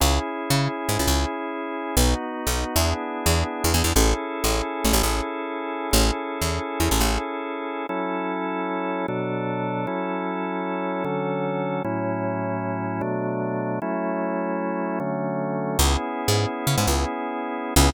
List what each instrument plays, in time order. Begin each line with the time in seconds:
0.00 electric bass (finger) C#2, drawbar organ C#4 E4 G#4
0.50 electric bass (finger) C#3
0.89 electric bass (finger) G#2
0.99 electric bass (finger) C#2
1.07 electric bass (finger) C#2
1.97 electric bass (finger) B1, drawbar organ B3 D#4 F#4
2.47 electric bass (finger) B1
2.76 electric bass (finger) E2, drawbar organ B3 D4 E4 G#4
3.26 electric bass (finger) E2
3.64 electric bass (finger) E2
3.74 electric bass (finger) E2
3.84 electric bass (finger) E2
3.95 electric bass (finger) A1, drawbar organ C#4 E4 G#4 A4
4.44 electric bass (finger) A1
4.85 electric bass (finger) A1
4.93 electric bass (finger) A1
5.03 electric bass (finger) A1
5.91 electric bass (finger) A1, drawbar organ C#4 E4 G#4 A4
6.42 electric bass (finger) E2
6.80 electric bass (finger) E2
6.91 electric bass (finger) A1
7.00 electric bass (finger) A1
7.89 drawbar organ F#3 C#4 E4 A4
9.08 drawbar organ B2 F#3 D4 A4
9.87 drawbar organ F#3 C#4 E4 A4
11.04 drawbar organ D3 F#3 C#4 A4
11.84 drawbar organ A2 F#3 C#4 E4
13.01 drawbar organ B2 F#3 A3 D4
13.82 drawbar organ F#3 A3 C#4 E4
15.00 drawbar organ D3 F#3 A3 C#4
15.79 electric bass (finger) C#2, drawbar organ B3 C#4 E4 G#4
16.28 electric bass (finger) G#2
16.67 electric bass (finger) C#3
16.78 electric bass (finger) G#2
16.87 electric bass (finger) C#2
17.76 electric bass (finger) C#2, drawbar organ B3 C#4 E4 G#4